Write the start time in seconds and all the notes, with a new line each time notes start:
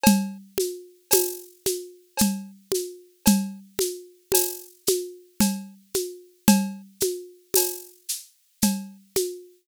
0.04 cowbell, low conga, shaker
0.58 high conga, shaker
1.11 tambourine, cowbell, high conga, shaker
1.66 high conga, shaker
2.17 cowbell, shaker
2.21 low conga
2.72 high conga, shaker
3.26 cowbell, low conga, shaker
3.79 high conga, shaker
4.32 tambourine, cowbell, high conga, shaker
4.87 high conga, shaker
5.40 cowbell, low conga, shaker
5.94 high conga, shaker
6.48 cowbell, low conga, shaker
7.01 high conga, shaker
7.54 tambourine, cowbell, high conga, shaker
8.09 shaker
8.62 cowbell, low conga, shaker
9.16 high conga, shaker